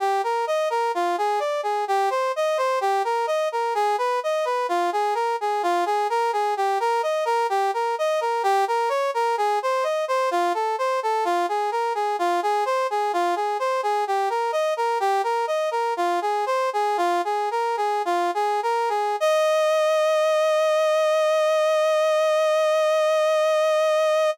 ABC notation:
X:1
M:4/4
L:1/16
Q:1/4=64
K:Eb
V:1 name="Brass Section"
G B e B F A d A G c e c G B e B | A _c e c F A B A F A B A G B e B | G B e B G B _d B A c e c F =A c A | F A B A F A c A F A c A G B e B |
"^rit." G B e B F A c A F A B A F A B A | e16 |]